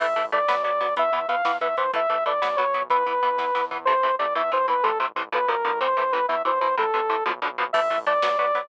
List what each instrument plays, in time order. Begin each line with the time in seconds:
0.00 synth bass 1 A1, overdriven guitar E3 A3, lead 2 (sawtooth) E5, kick, crash
0.08 kick
0.16 synth bass 1 A1, overdriven guitar E3 A3, kick, closed hi-hat
0.25 kick
0.32 synth bass 1 A1, overdriven guitar E3 A3, lead 2 (sawtooth) D5, kick, closed hi-hat
0.40 kick
0.48 synth bass 1 B1, overdriven guitar F#3 B3, kick, snare
0.57 kick
0.63 synth bass 1 B1, overdriven guitar F#3 B3, lead 2 (sawtooth) D5, kick, closed hi-hat
0.73 kick
0.81 synth bass 1 B1, overdriven guitar F#3 B3, kick, open hi-hat
0.89 kick
0.96 synth bass 1 E2, overdriven guitar E3 B3, lead 2 (sawtooth) E5, kick, closed hi-hat
1.05 kick
1.12 synth bass 1 E2, overdriven guitar E3 B3, lead 2 (sawtooth) E5, kick, closed hi-hat
1.21 kick
1.28 synth bass 1 E2, overdriven guitar E3 B3, lead 2 (sawtooth) F5, kick, closed hi-hat
1.37 kick
1.45 synth bass 1 E2, overdriven guitar E3 B3, kick, snare
1.53 kick
1.61 synth bass 1 E2, overdriven guitar E3 B3, lead 2 (sawtooth) E5, kick, closed hi-hat
1.69 kick
1.77 synth bass 1 E2, overdriven guitar E3 B3, lead 2 (sawtooth) C5, kick, closed hi-hat
1.86 kick
1.93 synth bass 1 A1, overdriven guitar E3 A3, lead 2 (sawtooth) E5, kick, closed hi-hat
2.02 kick
2.09 synth bass 1 A1, overdriven guitar E3 A3, kick, closed hi-hat
2.18 kick
2.26 synth bass 1 A1, overdriven guitar E3 A3, lead 2 (sawtooth) D5, kick, closed hi-hat
2.34 kick
2.42 synth bass 1 B1, overdriven guitar F#3 B3, kick, snare
2.50 kick
2.56 synth bass 1 B1, overdriven guitar F#3 B3, lead 2 (sawtooth) C#5, kick, closed hi-hat
2.66 kick
2.74 synth bass 1 B1, overdriven guitar F#3 B3, kick, closed hi-hat
2.82 kick
2.90 synth bass 1 E2, overdriven guitar E3 B3, lead 2 (sawtooth) B4, kick, closed hi-hat
2.99 kick
3.06 synth bass 1 E2, overdriven guitar E3 B3, kick, closed hi-hat
3.14 kick
3.23 synth bass 1 E2, overdriven guitar E3 B3, kick, closed hi-hat
3.31 kick
3.37 synth bass 1 E2, overdriven guitar E3 B3, kick, snare
3.55 synth bass 1 E2, overdriven guitar E3 B3, snare
3.71 synth bass 1 E2, overdriven guitar E3 B3, floor tom
3.85 synth bass 1 A1, overdriven guitar C3 E3 A3, lead 2 (sawtooth) C5
4.03 synth bass 1 A1, overdriven guitar C3 E3 A3
4.19 synth bass 1 A1, overdriven guitar C3 E3 A3, lead 2 (sawtooth) D5
4.35 synth bass 1 E2, overdriven guitar B2 E3, lead 2 (sawtooth) E5
4.52 synth bass 1 E2, overdriven guitar B2 E3, lead 2 (sawtooth) C5
4.68 synth bass 1 E2, overdriven guitar B2 E3, lead 2 (sawtooth) B4
4.83 synth bass 1 A1, overdriven guitar A2 C3 E3, lead 2 (sawtooth) A4
4.98 synth bass 1 A1, overdriven guitar A2 C3 E3
5.15 synth bass 1 A1, overdriven guitar A2 C3 E3
5.32 synth bass 1 B1, overdriven guitar B2 D3 F3, lead 2 (sawtooth) B4
5.48 synth bass 1 B1, overdriven guitar B2 D3 F3, lead 2 (sawtooth) A#4
5.64 synth bass 1 A1, overdriven guitar B2 D3 F3
5.81 overdriven guitar A2 C3 E3, lead 2 (sawtooth) C5
5.97 synth bass 1 A1, overdriven guitar A2 C3 E3
6.12 synth bass 1 A1, overdriven guitar A2 C3 E3, lead 2 (sawtooth) B4
6.28 synth bass 1 E2, overdriven guitar B2 E3, lead 2 (sawtooth) E5
6.45 synth bass 1 E2, overdriven guitar B2 E3, lead 2 (sawtooth) C5
6.60 synth bass 1 E2, overdriven guitar B2 E3, lead 2 (sawtooth) C5
6.77 synth bass 1 A1, overdriven guitar A2 C3 E3, lead 2 (sawtooth) A4
6.94 synth bass 1 A1, overdriven guitar A2 C3 E3
7.09 synth bass 1 A1, overdriven guitar A2 C3 E3
7.26 synth bass 1 B1, overdriven guitar B2 D3 F3
7.42 synth bass 1 B1, overdriven guitar B2 D3 F3
7.57 synth bass 1 B1, overdriven guitar B2 D3 F3
7.73 synth bass 1 A1, overdriven guitar E3 A3, lead 2 (sawtooth) E5, kick, crash
7.82 kick
7.90 synth bass 1 A1, overdriven guitar E3 A3, kick, closed hi-hat
7.98 kick
8.06 synth bass 1 A1, overdriven guitar E3 A3, lead 2 (sawtooth) D5, kick, closed hi-hat
8.14 kick
8.22 synth bass 1 B1, overdriven guitar F#3 B3, kick, snare
8.31 kick
8.38 synth bass 1 B1, overdriven guitar F#3 B3, lead 2 (sawtooth) D5, kick, closed hi-hat
8.47 kick
8.55 synth bass 1 B1, overdriven guitar F#3 B3, kick, open hi-hat
8.63 kick